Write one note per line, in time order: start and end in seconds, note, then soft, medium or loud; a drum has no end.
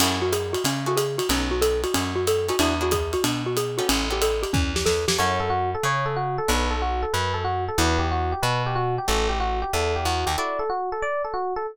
0.00 0.56 F#2 medium
0.00 0.20 C#4 medium
0.00 0.25 E4 medium
0.00 0.25 F#4 medium
0.00 0.25 G#4 medium
0.00 0.25 A4 medium
0.00 crash medium
0.00 ride loud
0.22 0.32 F#4 medium
0.32 0.52 G#4 medium
0.32 hi-hat pedal medium
0.32 ride medium
0.53 0.63 F#4 medium
0.53 ride medium
0.64 1.21 C#3 medium
0.64 0.86 C#4 medium
0.64 ride loud
0.86 1.06 E4 medium
0.86 1.06 F#4 medium
0.86 0.98 F#4 medium
0.86 1.06 G#4 medium
0.86 1.06 A4 medium
0.97 1.17 G#4 medium
0.97 hi-hat pedal medium
0.97 ride medium
1.18 1.28 F#4 medium
1.18 ride medium
1.29 1.86 B1 medium
1.29 1.55 C#4 medium
1.29 1.51 C#4 medium
1.29 1.55 D#4 medium
1.29 1.55 A4 medium
1.29 1.55 B4 medium
1.29 ride medium
1.51 1.61 F#4 medium
1.61 1.81 A4 medium
1.61 hi-hat pedal medium
1.61 ride medium
1.84 1.94 F#4 medium
1.84 ride medium
1.94 2.51 F#2 medium
1.94 2.14 C#4 medium
1.94 ride medium
2.16 2.26 F#4 medium
2.27 2.48 A4 medium
2.27 hi-hat pedal medium
2.27 ride medium
2.48 2.56 C#4 medium
2.48 2.56 D#4 medium
2.48 2.60 F#4 medium
2.48 2.56 A4 medium
2.48 2.56 B4 medium
2.48 ride medium
2.59 3.16 E2 medium
2.59 2.75 D4 medium
2.59 2.79 D4 medium
2.59 2.75 E4 medium
2.59 2.75 F#4 medium
2.59 2.75 G#4 medium
2.59 ride medium
2.81 3.00 D4 medium
2.81 3.00 E4 medium
2.81 3.00 F#4 medium
2.81 2.93 F#4 medium
2.81 3.00 G#4 medium
2.91 3.12 G#4 medium
2.91 kick medium
2.91 hi-hat pedal medium
2.91 ride medium
3.13 3.23 F#4 medium
3.13 ride medium
3.24 3.81 B2 medium
3.24 3.44 D4 medium
3.24 ride medium
3.46 3.56 F#4 medium
3.57 3.77 G#4 medium
3.57 hi-hat pedal medium
3.57 ride medium
3.78 4.05 B3 medium
3.78 4.05 C#4 medium
3.78 3.88 F#4 medium
3.78 4.05 G4 medium
3.78 4.05 A4 medium
3.78 ride medium
3.89 4.45 A1 medium
3.89 4.09 C#4 medium
3.89 ride medium
4.10 4.30 B3 medium
4.10 4.30 C#4 medium
4.10 4.30 G4 medium
4.10 4.22 G4 medium
4.10 4.30 A4 medium
4.22 4.42 A4 medium
4.22 hi-hat pedal medium
4.22 ride medium
4.43 4.52 G4 medium
4.43 ride medium
4.53 4.85 E2 medium
4.53 4.73 C#4 medium
4.53 kick medium
4.76 4.86 G4 medium
4.76 snare medium
4.86 5.06 E2 medium
4.86 5.06 A4 medium
4.86 snare medium
5.08 5.18 F2 medium
5.08 5.18 G4 medium
5.08 snare loud
5.18 5.76 F#2 medium
5.18 5.44 C#4 medium
5.18 5.44 E4 medium
5.18 5.44 F#4 medium
5.18 5.44 A4 medium
5.18 5.39 C#5 medium
5.40 5.50 A4 medium
5.50 5.70 F#4 medium
5.75 5.84 A4 medium
5.83 6.40 C#3 medium
5.83 6.05 C#5 medium
6.06 6.16 A4 medium
6.16 6.36 F#4 medium
6.38 6.48 A4 medium
6.48 7.05 B1 medium
6.48 6.74 B3 medium
6.48 6.74 D4 medium
6.48 6.74 F#4 medium
6.48 6.74 A4 medium
6.48 6.68 B4 medium
6.71 6.80 A4 medium
6.82 7.02 F#4 medium
7.02 7.12 A4 medium
7.13 7.70 F#2 medium
7.13 7.33 B4 medium
7.34 7.44 A4 medium
7.44 7.64 F#4 medium
7.68 7.78 A4 medium
7.78 8.34 E2 loud
7.78 8.05 D4 medium
7.78 8.05 E4 medium
7.78 8.05 F#4 medium
7.78 8.05 G4 medium
7.78 7.99 B4 medium
7.99 8.08 G4 medium
8.11 8.31 F#4 medium
8.32 8.42 G4 medium
8.42 8.99 B2 medium
8.42 8.62 B4 medium
8.66 8.76 G4 medium
8.75 8.95 F#4 medium
8.98 9.08 G4 medium
9.08 9.64 A1 medium
9.08 9.34 C#4 medium
9.08 9.34 F#4 medium
9.08 9.34 G4 medium
9.08 9.34 A4 medium
9.08 9.28 A4 medium
9.29 9.39 G4 medium
9.40 9.60 F#4 medium
9.62 9.72 G4 medium
9.73 10.05 E2 medium
9.73 9.94 A4 medium
9.96 10.06 G4 medium
10.05 10.25 E2 medium
10.05 10.26 F#4 medium
10.26 10.36 D#2 medium
10.26 10.36 G4 medium
10.38 10.64 D4 medium
10.38 10.64 E4 medium
10.38 10.64 F#4 medium
10.38 10.64 A4 medium
10.38 10.59 D5 medium
10.59 10.69 A4 medium
10.70 10.90 F#4 medium
10.92 11.02 A4 medium
11.02 11.22 D5 medium
11.24 11.34 A4 medium
11.34 11.54 F#4 medium
11.56 11.66 A4 medium